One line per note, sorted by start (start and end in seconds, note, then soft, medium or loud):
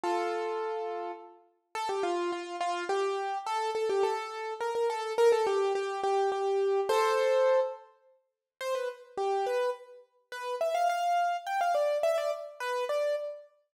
0.03 1.12 F4 medium
0.03 1.12 A4 medium
1.75 1.88 A4 loud
1.89 2.03 G4 medium
2.03 2.31 F4 loud
2.32 2.56 F4 medium
2.60 2.84 F4 loud
2.89 3.38 G4 medium
3.46 3.70 A4 loud
3.75 3.88 A4 medium
3.89 4.03 G4 medium
4.03 4.54 A4 medium
4.60 4.74 A#4 medium
4.75 4.89 A#4 medium
4.90 5.13 A4 loud
5.18 5.31 A#4 loud
5.32 5.46 A4 medium
5.47 5.73 G4 medium
5.75 6.01 G4 medium
6.03 6.30 G4 loud
6.32 6.80 G4 medium
6.89 7.60 A4 loud
6.89 7.60 C5 loud
8.61 8.74 C5 loud
8.75 8.88 B4 medium
9.17 9.45 G4 medium
9.46 9.70 B4 medium
10.32 10.55 B4 medium
10.61 10.74 E5 medium
10.74 10.88 F5 medium
10.89 11.37 F5 medium
11.46 11.60 G5 medium
11.61 11.74 F5 medium
11.75 11.98 D5 medium
12.03 12.17 E5 medium
12.18 12.31 D5 medium
12.60 12.84 B4 medium
12.89 13.15 D5 medium